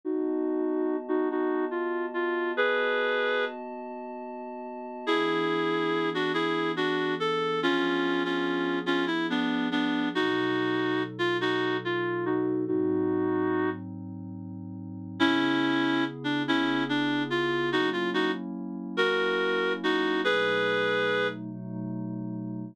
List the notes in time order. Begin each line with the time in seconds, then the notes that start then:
0.05 B3 D#4 F#4 D#5 A5
1.08 D#4 F#4
1.31 D#4 F#4
1.71 F4
2.14 F4
2.55 B3 F#4 G#4 B4 D#5 A5
5.07 E3 B3 D4 E4 G#4
6.14 D4 F#4
6.34 E4 G#4
6.76 D4 F#4
7.20 A4
7.61 F3 B3 C#4 D4 F4 G#4
8.25 C#4 F4
8.86 C#4 F4
9.07 E4
9.30 B3 D4
9.71 B3 D4
10.15 B2 F#3 D#4 F#4 A4
11.19 F4
11.41 D#4 F#4
11.85 F4
12.26 D#4 F#4
12.65 G#2 F#3 C4 D#4 F#4
15.19 C#3 B3 C#4 E4 G#4
16.24 D4
16.46 C#3 B3 C#4 E4 G#4
16.89 D4
17.30 F4
17.71 F#3 A#3 C#4 D#4 E4 F#4
17.93 F4
18.14 D#4 F#4
18.97 F#3 A#3 C#4 E4 F#4 A#4
19.84 D#4 F#4
20.24 B2 F#3 A3 D#4 G#4 B4
21.51 B2 F#3 A3 D#4